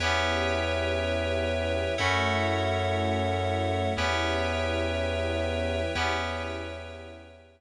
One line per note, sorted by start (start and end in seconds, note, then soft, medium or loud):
0.00 1.82 E2 medium
0.00 1.95 B3 medium
0.00 1.96 B3 medium
0.00 1.95 C#4 medium
0.00 1.96 C#4 loud
0.00 1.95 E4 medium
0.00 1.96 E4 medium
0.00 1.95 G4 medium
0.00 1.96 G4 loud
0.00 1.95 B4 loud
0.00 1.95 C#5 loud
0.00 1.95 E5 loud
0.00 1.95 G5 medium
1.98 3.82 F#2 loud
1.98 3.94 A3 loud
1.98 3.93 A3 loud
1.98 3.94 C#4 medium
1.98 3.93 C#4 loud
1.98 3.94 E4 medium
1.98 3.93 E4 loud
1.98 3.94 F#4 medium
1.98 3.93 F#4 loud
1.98 3.92 A4 medium
1.98 3.92 C#5 medium
1.98 3.92 E5 medium
1.98 3.92 F#5 loud
3.96 5.80 E2 loud
3.96 5.91 B3 medium
3.96 5.94 B3 medium
3.96 5.91 C#4 medium
3.96 5.94 C#4 medium
3.96 5.91 E4 loud
3.96 5.94 E4 medium
3.96 5.91 G4 medium
3.96 5.94 G4 medium
3.96 5.92 B4 medium
3.96 5.92 C#5 medium
3.96 5.92 E5 medium
3.96 5.92 G5 medium
5.95 7.61 E2 loud
5.95 7.61 B3 medium
5.95 7.61 C#4 loud
5.95 7.61 E4 loud
5.95 7.61 E4 medium
5.95 7.61 G4 medium
5.95 7.61 B4 medium
5.95 7.61 C#5 medium
5.95 7.61 E5 medium
5.95 7.61 G5 medium